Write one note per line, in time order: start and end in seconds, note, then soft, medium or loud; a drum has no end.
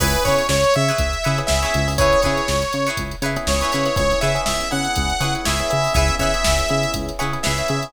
0.00 0.16 C#2 medium
0.00 0.41 B3 medium
0.00 0.41 C#4 medium
0.00 0.41 E4 medium
0.00 0.20 E4 medium
0.00 0.41 G#4 medium
0.00 0.20 G#4 medium
0.00 0.24 B4 medium
0.00 0.20 B4 medium
0.00 0.20 C#5 medium
0.00 kick loud
0.00 crash loud
0.14 closed hi-hat medium
0.24 0.42 C#3 medium
0.24 0.66 E4 medium
0.24 0.66 G#4 medium
0.24 0.66 B4 medium
0.24 0.47 C#5 medium
0.24 0.66 C#5 medium
0.24 kick medium
0.24 closed hi-hat medium
0.38 closed hi-hat medium
0.49 0.64 C#2 medium
0.49 0.74 C#5 medium
0.49 snare loud
0.64 closed hi-hat medium
0.74 0.91 C#3 medium
0.74 1.39 E5 medium
0.74 closed hi-hat medium
0.88 1.18 G#4 medium
0.88 1.18 B4 medium
0.88 1.18 C#5 medium
0.88 snare soft
0.88 closed hi-hat medium
0.92 1.18 E4 medium
0.98 1.14 C#2 medium
0.98 kick medium
0.98 closed hi-hat loud
1.13 closed hi-hat medium
1.24 1.41 C#3 medium
1.24 1.54 E4 medium
1.24 1.54 G#4 medium
1.24 1.54 B4 medium
1.24 1.54 C#5 medium
1.24 closed hi-hat medium
1.38 1.77 B3 medium
1.38 1.77 C#4 medium
1.38 1.77 E4 medium
1.38 1.77 G#4 medium
1.38 closed hi-hat medium
1.47 1.65 C#2 medium
1.47 1.91 E5 medium
1.47 snare loud
1.63 1.92 E4 medium
1.63 1.92 G#4 medium
1.63 1.92 B4 medium
1.63 1.92 C#5 medium
1.63 closed hi-hat medium
1.74 2.15 C#2 medium
1.74 closed hi-hat medium
1.88 1.96 B3 medium
1.88 1.96 C#4 medium
1.88 1.96 E4 medium
1.88 1.96 G#4 medium
1.88 open hi-hat medium
1.98 2.39 B3 medium
1.98 2.39 C#4 medium
1.98 2.39 E4 medium
1.98 2.19 E4 medium
1.98 2.39 G#4 medium
1.98 2.19 G#4 medium
1.98 2.19 B4 medium
1.98 2.21 C#5 medium
1.98 2.19 C#5 medium
1.98 kick loud
1.98 closed hi-hat loud
2.13 closed hi-hat medium
2.21 2.64 G#4 medium
2.21 2.64 B4 medium
2.21 2.88 C#5 medium
2.21 2.64 C#5 medium
2.21 kick medium
2.21 closed hi-hat medium
2.26 2.41 C#3 medium
2.26 2.64 E4 medium
2.37 closed hi-hat medium
2.48 2.64 C#2 medium
2.48 snare loud
2.62 snare soft
2.62 closed hi-hat medium
2.72 2.89 C#3 medium
2.72 snare soft
2.72 closed hi-hat medium
2.87 3.16 E4 medium
2.87 3.16 G#4 medium
2.87 3.16 B4 medium
2.87 3.16 C#5 medium
2.87 closed hi-hat medium
2.97 3.14 C#2 medium
2.97 kick medium
2.97 closed hi-hat loud
3.11 closed hi-hat medium
3.22 3.37 C#3 medium
3.22 3.53 E4 medium
3.22 3.53 G#4 medium
3.22 3.53 B4 medium
3.22 3.53 C#5 medium
3.22 closed hi-hat medium
3.36 3.75 B3 medium
3.36 3.75 C#4 medium
3.36 3.75 E4 medium
3.36 3.75 G#4 medium
3.36 closed hi-hat medium
3.47 3.63 C#2 medium
3.47 3.96 C#5 medium
3.47 snare loud
3.61 3.71 E4 medium
3.61 3.71 G#4 medium
3.61 3.71 B4 medium
3.61 3.71 C#5 medium
3.61 closed hi-hat medium
3.72 3.89 C#3 medium
3.72 4.17 E4 medium
3.72 4.17 G#4 medium
3.72 4.17 B4 medium
3.72 4.17 C#5 medium
3.72 closed hi-hat medium
3.85 3.94 B3 medium
3.85 3.94 C#4 medium
3.85 3.94 E4 medium
3.85 3.94 G#4 medium
3.85 snare soft
3.85 closed hi-hat medium
3.96 4.14 C#2 medium
3.96 4.07 B3 medium
3.96 4.07 C#4 medium
3.96 4.07 E4 medium
3.96 4.07 G#4 medium
3.96 4.20 C#5 medium
3.96 kick loud
3.96 closed hi-hat loud
4.11 4.30 B3 medium
4.11 4.30 C#4 medium
4.11 4.30 E4 medium
4.11 4.30 G#4 medium
4.11 snare soft
4.11 closed hi-hat medium
4.21 4.38 C#3 medium
4.21 4.62 E4 medium
4.21 4.62 G#4 medium
4.21 4.62 B4 medium
4.21 4.62 C#5 medium
4.21 4.42 E5 medium
4.21 closed hi-hat medium
4.35 4.64 B3 medium
4.35 4.64 C#4 medium
4.35 4.64 E4 medium
4.35 4.64 G#4 medium
4.35 closed hi-hat medium
4.46 4.62 C#2 medium
4.46 4.69 E5 medium
4.46 snare loud
4.61 closed hi-hat medium
4.71 4.88 C#3 medium
4.71 5.12 B3 medium
4.71 5.12 C#4 medium
4.71 5.12 E4 medium
4.71 5.12 G#4 medium
4.71 5.34 F#5 medium
4.71 closed hi-hat medium
4.85 closed hi-hat medium
4.96 5.12 C#2 medium
4.96 kick medium
4.96 closed hi-hat loud
5.10 closed hi-hat medium
5.20 5.36 C#3 medium
5.20 5.32 B3 medium
5.20 5.32 C#4 medium
5.20 5.32 E4 medium
5.20 5.41 E4 medium
5.20 5.32 G#4 medium
5.20 5.41 G#4 medium
5.20 5.41 B4 medium
5.20 5.41 C#5 medium
5.20 closed hi-hat medium
5.35 5.54 B3 medium
5.35 5.54 C#4 medium
5.35 5.54 E4 medium
5.35 5.54 G#4 medium
5.35 closed hi-hat medium
5.45 5.62 C#2 medium
5.45 5.86 E4 medium
5.45 5.86 G#4 medium
5.45 5.86 B4 medium
5.45 5.86 C#5 medium
5.45 5.93 E5 medium
5.45 snare loud
5.59 5.68 B3 medium
5.59 5.68 C#4 medium
5.59 5.68 E4 medium
5.59 5.68 G#4 medium
5.59 closed hi-hat medium
5.70 5.88 C#3 medium
5.70 6.06 B3 medium
5.70 6.06 C#4 medium
5.70 6.06 E4 loud
5.70 6.06 G#4 medium
5.70 closed hi-hat medium
5.84 open hi-hat medium
5.94 6.10 C#2 medium
5.94 6.15 G#4 medium
5.94 6.15 B4 medium
5.94 6.15 C#5 medium
5.94 6.15 E5 medium
5.94 kick loud
5.94 closed hi-hat loud
5.98 6.15 E4 medium
6.08 6.29 B3 medium
6.08 6.29 C#4 medium
6.08 6.29 E4 medium
6.08 6.29 G#4 medium
6.08 closed hi-hat medium
6.19 6.34 C#3 medium
6.19 6.61 G#4 medium
6.19 6.61 B4 medium
6.19 6.61 C#5 medium
6.19 6.92 E5 medium
6.19 kick medium
6.19 closed hi-hat medium
6.23 6.61 E4 medium
6.34 6.63 B3 medium
6.34 6.63 C#4 medium
6.34 6.63 E4 medium
6.34 6.63 G#4 medium
6.34 closed hi-hat medium
6.44 6.62 C#2 medium
6.44 snare loud
6.59 closed hi-hat medium
6.69 6.86 C#3 medium
6.69 7.11 B3 medium
6.69 7.11 C#4 medium
6.69 7.11 E4 medium
6.69 7.11 G#4 medium
6.69 closed hi-hat medium
6.83 closed hi-hat medium
6.94 7.11 C#2 medium
6.94 kick medium
6.94 closed hi-hat loud
7.09 closed hi-hat medium
7.19 7.36 C#3 medium
7.19 7.30 B3 medium
7.19 7.30 C#4 medium
7.19 7.30 E4 medium
7.19 7.39 E4 medium
7.19 7.30 G#4 medium
7.19 7.39 G#4 medium
7.19 7.39 B4 medium
7.19 7.39 C#5 medium
7.19 closed hi-hat medium
7.33 7.52 B3 medium
7.33 7.52 C#4 medium
7.33 7.52 E4 medium
7.33 7.52 G#4 medium
7.33 closed hi-hat medium
7.43 7.62 C#2 medium
7.43 7.85 G#4 medium
7.43 7.85 B4 medium
7.43 7.85 C#5 medium
7.43 7.85 E5 medium
7.43 snare loud
7.47 7.85 E4 medium
7.58 7.67 B3 medium
7.58 7.67 C#4 medium
7.58 7.67 E4 medium
7.58 7.67 G#4 medium
7.58 closed hi-hat medium
7.68 7.85 C#3 medium
7.68 7.89 B3 medium
7.68 7.89 C#4 medium
7.68 7.89 E4 medium
7.68 7.89 G#4 medium
7.68 closed hi-hat medium
7.83 closed hi-hat medium